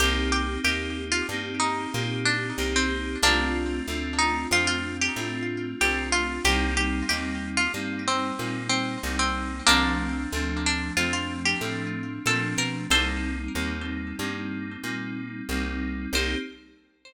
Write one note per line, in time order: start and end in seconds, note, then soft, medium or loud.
0.00 0.58 C2 loud
0.00 0.60 A#3 loud
0.00 0.60 C4 medium
0.00 0.60 D#4 medium
0.00 0.28 G4 loud
0.00 0.60 G4 medium
0.32 0.59 G4 loud
0.63 1.22 D#2 medium
0.63 1.21 A#3 medium
0.63 1.21 C4 medium
0.63 1.21 D#4 medium
0.63 1.21 G4 medium
0.63 1.05 G4 medium
1.12 1.27 F4 medium
1.29 1.87 G2 medium
1.29 1.89 A#3 medium
1.29 1.89 C4 medium
1.29 1.89 D#4 medium
1.29 1.89 G4 medium
1.60 2.20 D#4 medium
1.94 2.52 A#2 medium
1.94 2.52 A#3 medium
1.94 2.52 C4 medium
1.94 2.52 D#4 medium
1.94 2.52 G4 medium
2.25 2.65 D4 loud
2.58 3.16 C2 medium
2.58 3.16 A#3 medium
2.58 3.16 C4 medium
2.58 3.16 D#4 medium
2.58 3.16 G4 medium
2.76 3.18 C4 medium
3.23 3.81 C2 medium
3.23 3.82 A3 medium
3.23 4.05 A#3 medium
3.23 3.82 C4 medium
3.23 4.05 D4 loud
3.23 3.82 D4 medium
3.23 3.82 F4 medium
3.87 4.46 D2 medium
3.87 4.46 A3 medium
3.87 4.46 C4 medium
3.87 4.46 D4 medium
3.87 4.46 F4 medium
4.19 4.47 D#4 medium
4.51 5.09 F2 medium
4.51 5.09 A3 medium
4.51 5.09 C4 medium
4.51 5.09 D4 medium
4.51 5.09 F4 medium
4.51 4.67 F4 loud
4.67 4.96 F4 medium
5.01 5.44 G4 medium
5.16 5.74 A2 medium
5.16 5.74 A3 medium
5.16 5.74 C4 medium
5.16 5.74 D4 medium
5.16 5.74 F4 medium
5.80 6.39 C2 medium
5.80 6.38 A3 medium
5.80 6.38 C4 medium
5.80 6.38 D4 medium
5.80 6.38 F4 medium
5.80 6.08 G4 loud
6.12 6.43 F4 medium
6.45 7.03 C2 loud
6.45 7.03 G3 loud
6.45 7.03 A#3 medium
6.45 7.03 C4 loud
6.45 7.03 D#4 loud
6.45 6.74 G4 loud
6.77 7.08 G4 medium
7.08 7.68 D#2 medium
7.08 7.66 G3 medium
7.08 7.66 A#3 medium
7.08 7.66 C4 medium
7.08 7.66 D#4 medium
7.08 7.50 G4 medium
7.57 7.72 F4 loud
7.74 8.32 G2 medium
7.74 8.32 G3 medium
7.74 8.32 A#3 medium
7.74 8.32 C4 medium
7.74 8.32 D#4 medium
8.08 8.69 C4 medium
8.38 8.97 A#2 medium
8.38 8.96 G3 medium
8.38 8.96 A#3 medium
8.38 8.96 C4 medium
8.38 8.96 D#4 medium
8.69 9.15 C4 medium
9.03 9.61 C2 medium
9.03 9.61 G3 medium
9.03 9.61 A#3 medium
9.03 9.61 C4 medium
9.03 9.61 D#4 medium
9.19 9.63 C4 medium
9.67 10.26 C2 loud
9.67 10.26 F3 medium
9.67 10.26 A3 medium
9.67 10.46 A#3 loud
9.67 10.26 C4 medium
9.67 10.46 D4 loud
9.67 10.26 D4 loud
10.33 10.91 D2 medium
10.33 10.91 F3 medium
10.33 10.91 A3 medium
10.33 10.91 C4 medium
10.33 10.91 D4 medium
10.66 10.92 D4 medium
10.97 11.55 F2 medium
10.97 11.55 F3 medium
10.97 11.55 A3 medium
10.97 11.55 C4 medium
10.97 11.55 D4 medium
10.97 11.12 F4 medium
11.13 11.42 F4 medium
11.45 11.87 G4 medium
11.61 12.19 A2 medium
11.61 12.19 F3 medium
11.61 12.19 A3 medium
11.61 12.19 C4 medium
11.61 12.19 D4 medium
12.26 12.55 A#2 medium
12.26 12.84 F3 medium
12.26 12.84 A3 medium
12.26 12.84 C4 medium
12.26 12.84 D4 medium
12.26 12.58 A4 medium
12.58 12.87 B2 medium
12.58 12.87 A#4 medium
12.90 13.48 C2 medium
12.90 13.49 G3 medium
12.90 13.49 A#3 medium
12.90 13.49 C4 loud
12.90 13.49 D#4 medium
12.90 14.16 A4 medium
12.90 14.16 C5 loud
13.55 14.13 D#2 medium
13.55 14.13 G3 medium
13.55 14.13 A#3 medium
13.55 14.13 C4 medium
13.55 14.13 D#4 medium
14.19 14.77 G2 medium
14.19 14.78 G3 medium
14.19 14.78 A#3 medium
14.19 14.78 C4 medium
14.19 14.78 D#4 medium
14.83 15.42 A#2 medium
14.83 15.41 G3 medium
14.83 15.41 A#3 medium
14.83 15.41 C4 medium
14.83 15.41 D#4 medium
15.49 16.07 C2 medium
15.49 16.08 G3 medium
15.49 16.08 A#3 medium
15.49 16.08 C4 medium
15.49 16.08 D#4 medium
16.13 16.35 C2 medium
16.13 16.36 A#3 medium
16.13 16.36 C4 loud
16.13 16.36 D#4 medium
16.13 16.36 G4 loud
16.13 16.38 C5 loud